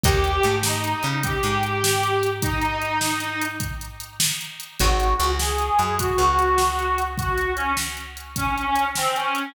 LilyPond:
<<
  \new Staff \with { instrumentName = "Harmonica" } { \time 12/8 \key ees \major \tempo 4. = 101 g'4. ees'4. g'2. | ees'2. r2. | ges'4. aes'4. ges'2. | ges'4 des'8 r4. des'16 des'16 des'16 des'16 des'16 r16 c'8 des'4 | }
  \new Staff \with { instrumentName = "Acoustic Guitar (steel)" } { \time 12/8 \key ees \major <bes' des'' ees'' g''>4 a4. des'4 aes2~ aes8~ | aes1. | <c' ees' ges' aes'>4 des4. ges4 des2~ des8~ | des1. | }
  \new Staff \with { instrumentName = "Electric Bass (finger)" } { \clef bass \time 12/8 \key ees \major ees,4 aes,4. des4 aes,2~ aes,8~ | aes,1. | aes,,4 des,4. ges,4 des,2~ des,8~ | des,1. | }
  \new DrumStaff \with { instrumentName = "Drums" } \drummode { \time 12/8 <hh bd>8 hh8 hh8 sn8 hh8 hh8 <hh bd>8 hh8 hh8 sn8 hh8 hh8 | <hh bd>8 hh8 hh8 sn8 hh8 hh8 <hh bd>8 hh8 hh8 sn8 hh8 hh8 | <hh bd>8 hh8 hh8 sn8 hh8 hh8 <hh bd>8 hh8 hh8 sn8 hh8 hh8 | <hh bd>8 hh8 hh8 sn8 hh8 hh8 <hh bd>8 hh8 hh8 sn8 hh8 hh8 | }
>>